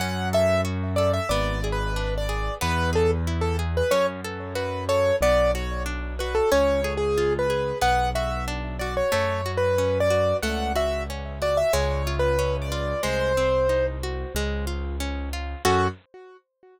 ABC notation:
X:1
M:4/4
L:1/16
Q:1/4=92
K:F#m
V:1 name="Acoustic Grand Piano"
f2 e2 z2 d e (3d4 B4 d4 | B2 A z2 A z B c z3 B2 c2 | d2 c2 z2 B A (3c4 G4 B4 | f2 e2 z2 d c (3c4 B4 d4 |
f2 e2 z2 d e (3c4 B4 d4 | ^B6 z10 | F4 z12 |]
V:2 name="Orchestral Harp"
C2 A2 F2 A2 B,2 G2 D2 G2 | B,2 G2 E2 G2 C2 A2 F2 A2 | B,2 F2 D2 F2 C2 G2 ^E2 G2 | B,2 F2 D2 F2 A,2 F2 C2 F2 |
A,2 F2 C2 F2 G,2 ^E2 C2 E2 | G,2 ^B,2 ^D2 F2 G,2 ^E2 C2 E2 | [CFA]4 z12 |]
V:3 name="Acoustic Grand Piano" clef=bass
F,,8 G,,,8 | E,,8 F,,8 | B,,,8 C,,8 | B,,,8 F,,8 |
C,,8 C,,8 | ^B,,,8 C,,8 | F,,4 z12 |]